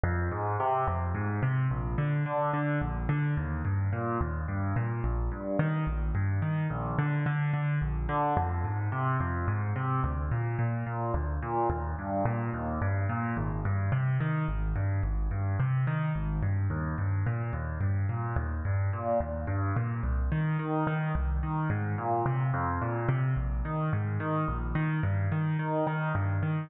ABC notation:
X:1
M:6/8
L:1/8
Q:3/8=72
K:Eb
V:1 name="Acoustic Grand Piano" clef=bass
F,, A,, C, F,, A,, C, | B,,, D, D, D, B,,, D, | E,, G,, B,, E,, G,, B,, | B,,, G,, E, B,,, G,, E, |
B,,, D, D, D, B,,, D, | F,, A,, C, F,, A,, C, | D,, B,, B,, B,, D,, B,, | E,, G,, B,, E,, G,, B,, |
A,,, G,, C, E, A,,, G,, | A,,, G,, C, E, A,,, G,, | E,, G,, B,, E,, G,, B,, | E,, G,, B,, E,, G,, B,, |
C,, E, E, E, C,, E, | A,, B,, C, F,, B,, C, | B,,, E, A,, E, B,,, E, | G,, E, E, E, G,, E, |]